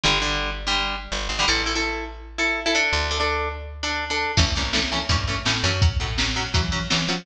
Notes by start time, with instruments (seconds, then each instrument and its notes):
0.04 electric bass (finger) G1, acoustic guitar (steel) D3 G3
0.21 acoustic guitar (steel) D3 G3
0.67 acoustic guitar (steel) D3 G3
1.12 electric bass (finger) G1
1.29 electric bass (finger) G#1
1.39 acoustic guitar (steel) D3 G3
1.48 electric bass (finger) A1, acoustic guitar (steel) E4 A4
1.66 acoustic guitar (steel) E4 A4
1.75 acoustic guitar (steel) E4 A4
2.38 acoustic guitar (steel) E4 A4
2.66 acoustic guitar (steel) E4 A4
2.75 acoustic guitar (steel) D4 A4
2.93 electric bass (finger) D2
3.11 acoustic guitar (steel) D4 A4
3.20 acoustic guitar (steel) D4 A4
3.83 acoustic guitar (steel) D4 A4
4.10 acoustic guitar (steel) D4 A4
4.37 electric bass (finger) A1, acoustic guitar (steel) E3 A3 C#4, kick, crash
4.55 electric bass (finger) C2, acoustic guitar (steel) E3 A3 C#4, closed hi-hat
4.73 acoustic guitar (steel) E3 A3 C#4, snare
4.92 acoustic guitar (steel) E3 A3 C#4, closed hi-hat
5.09 electric bass (finger) G2, acoustic guitar (steel) E3 A3 C#4, kick, closed hi-hat
5.27 acoustic guitar (steel) E3 A3 C#4, closed hi-hat
5.45 electric bass (finger) A2, acoustic guitar (steel) E3 A3 C#4, snare
5.64 electric bass (finger) F#2, acoustic guitar (steel) E3 A3 C#4, closed hi-hat
5.82 acoustic guitar (steel) F#3 C#4, kick, closed hi-hat
6.00 electric bass (finger) A2, acoustic guitar (steel) F#3 C#4, kick, closed hi-hat
6.18 acoustic guitar (steel) F#3 C#4, snare
6.36 acoustic guitar (steel) F#3 C#4, closed hi-hat
6.54 electric bass (finger) E3, acoustic guitar (steel) F#3 C#4, kick, closed hi-hat
6.72 acoustic guitar (steel) F#3 C#4, closed hi-hat
6.90 electric bass (finger) E3, acoustic guitar (steel) F#3 C#4, snare
7.08 electric bass (finger) F3, acoustic guitar (steel) F#3 C#4, open hi-hat